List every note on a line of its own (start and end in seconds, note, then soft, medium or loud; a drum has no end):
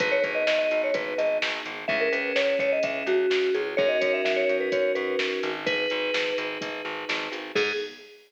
0.00 0.20 G#1 medium
0.00 1.70 B3 medium
0.00 1.70 D#4 medium
0.00 1.70 G#4 medium
0.00 0.12 B4 medium
0.00 kick loud
0.00 closed hi-hat loud
0.12 0.23 C#5 medium
0.23 0.44 G#1 medium
0.23 0.34 B4 medium
0.23 kick medium
0.23 closed hi-hat medium
0.35 0.46 D#5 medium
0.47 0.68 G#1 medium
0.47 0.58 D#5 medium
0.47 snare loud
0.59 0.81 D#5 medium
0.71 0.91 G#1 medium
0.71 closed hi-hat medium
0.84 0.95 C#5 medium
0.94 1.14 G#1 medium
0.94 1.16 B4 medium
0.94 kick loud
0.94 closed hi-hat loud
1.18 1.39 G#1 medium
1.18 1.37 D#5 medium
1.18 closed hi-hat medium
1.42 1.62 G#1 medium
1.42 snare loud
1.65 1.85 G#1 medium
1.65 closed hi-hat medium
1.88 2.09 C#2 loud
1.88 3.58 C#4 medium
1.88 3.58 E4 loud
1.88 3.58 G#4 loud
1.88 1.99 E5 medium
1.88 kick loud
2.00 2.12 A#4 medium
2.12 2.32 C#2 medium
2.12 2.34 B4 medium
2.12 closed hi-hat medium
2.36 2.56 C#2 medium
2.36 2.59 C#5 medium
2.36 snare loud
2.59 2.79 C#2 medium
2.59 2.71 C#5 medium
2.59 kick medium
2.59 closed hi-hat medium
2.72 2.84 D#5 medium
2.83 3.03 C#2 medium
2.83 3.06 E5 medium
2.83 kick loud
2.83 closed hi-hat loud
3.06 3.26 C#2 medium
3.06 3.53 F#4 medium
3.06 closed hi-hat medium
3.30 3.50 C#2 medium
3.30 snare loud
3.54 3.75 C#2 medium
3.54 3.76 G#4 medium
3.54 closed hi-hat medium
3.77 3.98 F#2 loud
3.77 5.49 C#4 medium
3.77 5.49 D#4 medium
3.77 5.49 F#4 medium
3.77 5.49 A#4 medium
3.77 3.88 C#5 medium
3.77 kick loud
3.89 4.00 D#5 medium
4.01 4.22 F#2 medium
4.01 4.12 C#5 medium
4.01 kick medium
4.01 closed hi-hat loud
4.13 4.24 E5 medium
4.25 4.45 F#2 medium
4.25 4.36 E5 medium
4.25 snare loud
4.36 4.57 C#5 medium
4.49 4.69 F#2 medium
4.49 closed hi-hat medium
4.61 4.72 B4 medium
4.72 4.93 F#2 medium
4.72 4.92 C#5 medium
4.72 kick loud
4.72 closed hi-hat loud
4.95 5.16 F#2 medium
4.95 5.15 B4 medium
4.95 closed hi-hat medium
5.19 5.40 F#2 medium
5.19 snare loud
5.43 5.87 G#1 loud
5.43 closed hi-hat medium
5.66 7.36 D#4 medium
5.66 7.36 G#4 loud
5.66 7.36 B4 medium
5.66 6.33 B4 medium
5.66 kick loud
5.66 closed hi-hat loud
5.90 6.11 G#1 medium
5.90 closed hi-hat medium
6.14 6.34 G#1 medium
6.14 snare loud
6.38 6.58 G#1 medium
6.38 closed hi-hat medium
6.61 6.82 G#1 medium
6.61 kick loud
6.61 closed hi-hat loud
6.85 7.05 G#1 medium
7.09 7.29 G#1 medium
7.09 snare loud
7.09 closed hi-hat medium
7.32 7.52 G#1 medium
7.32 closed hi-hat medium
7.55 7.72 G#2 loud
7.55 7.72 B3 loud
7.55 7.72 D#4 loud
7.55 7.72 G#4 loud
7.55 kick loud
7.55 crash loud